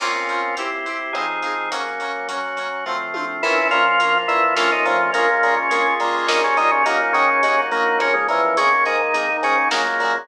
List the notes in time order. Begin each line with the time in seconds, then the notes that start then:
0.00 A#3 C4 C#4 F4, crash
0.04 F4
0.29 A#3 C4 C#4, closed hi-hat
0.33 F4
0.57 C4 E4 G4, closed hi-hat
0.86 C4 E4 G4, closed hi-hat
1.13 F3 C4 D#4 G#4, kick, cross-stick
1.17 D#4 G#4
1.43 F3 C4 D#4, closed hi-hat
1.47 G#4
1.71 F#3 A#3 C#4, closed hi-hat
2.00 F#3 A#3 C#4, closed hi-hat
2.28 F#3 A#3 C#4 F#4, closed hi-hat
2.56 F#3 A#3 C#4, closed hi-hat
2.86 F3 A3 C4, kick, floor tom
3.14 F3 A3 C4, high tom
3.43 A#1 E3 A#3 C#4 E4 F4, crash
3.71 A#2 F3 A#3 C#4 F4, closed hi-hat
4.00 A#1 F3 A#3 C#4 F4, closed hi-hat
4.28 A#2 E3 A#3 C#4 E4 F4, closed hi-hat
4.55 A#1 F3 A3 A#3 C#4 F4, kick, snare
4.60 C#4 F4
4.72 D#3 D#4
4.85 F2 A#2 F3 A3 A#3 C#4, closed hi-hat
4.90 F4
5.13 A#1 A#2 G#3 A#3 C#4 F4, closed hi-hat
5.18 C#4 F4
5.43 A#2 G#3 A#3 C#4, closed hi-hat
5.48 F4
5.57 C#3 C#4
5.70 A#1 G#3 A#3 C#4 F4 G#4, closed hi-hat
5.75 F4
6.00 A#2 G3 A#3 C#4, closed hi-hat
6.04 F4
6.27 A#1 D#3 G3 A#3 C#4 D#4 F4, kick, snare
6.44 C#3 C#4
6.57 A#2 D#3 G3 A#3 C#4 D#4, closed hi-hat
6.62 F4
6.71 C#3 C#4
6.85 D#2 A#2 F#3 A#3 C#4 D#4, closed hi-hat
6.90 D#4
7.13 C#3 D#3 F#3 A#3 C#4, closed hi-hat
7.18 D#4
7.43 D#2 F#3 A#3 C#4 D#4 F#4, closed hi-hat
7.48 D#4
7.71 A#1 A#2 F#3 A#3 C#4, closed hi-hat
7.76 D#4
7.98 C#3 F3 A#3 C#4, kick, cross-stick
8.03 C#4
8.14 G#2 G#3
8.28 E2 A#2 E3 F3 A#3 C#4, closed hi-hat
8.57 G#1 C#3 D#3 G#3 A#3 C#4, closed hi-hat
8.85 G#2 D#3 G#3 A#3 D#4, closed hi-hat
9.14 G#1 D#3 G#3 A#3 D#4, closed hi-hat
9.42 G#2 C#3 D#3 G#3 A#3 C#4, closed hi-hat
9.70 A#1 A#2 C#3 F#3 G#3 A#3, kick, snare
9.75 A#3
10.00 A#2 C#3 F#3 G#3, closed hi-hat
10.05 A#3